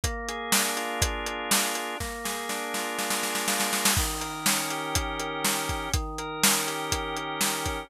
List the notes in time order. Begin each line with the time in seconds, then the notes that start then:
0.04 A#3, kick, closed hi-hat
0.28 G#4, closed hi-hat
0.52 D4, snare
0.76 F4, closed hi-hat
1.02 A#3, kick, closed hi-hat
1.26 G#4, closed hi-hat
1.51 F4, snare
1.75 D4, closed hi-hat
2.00 A#3, kick, snare
2.24 G#4, snare
2.49 D4, snare
2.74 F4, snare
2.99 A#3, snare
3.10 snare
3.23 G#4, snare
3.35 snare
3.48 F4, snare
3.60 snare
3.71 D4, snare
3.85 snare
3.97 D#3, kick, crash
4.20 A#4, closed hi-hat
4.46 C#4, snare
4.70 G4, closed hi-hat
4.95 D#3, kick, closed hi-hat
5.19 A#4, closed hi-hat
5.44 G4, snare
5.69 C#4, kick, closed hi-hat
5.93 D#3, kick, closed hi-hat
6.18 A#4, closed hi-hat
6.43 C#4, snare
6.67 G4, closed hi-hat
6.91 D#3, kick, closed hi-hat
7.16 A#4, closed hi-hat
7.41 G4, snare
7.66 C#4, kick, closed hi-hat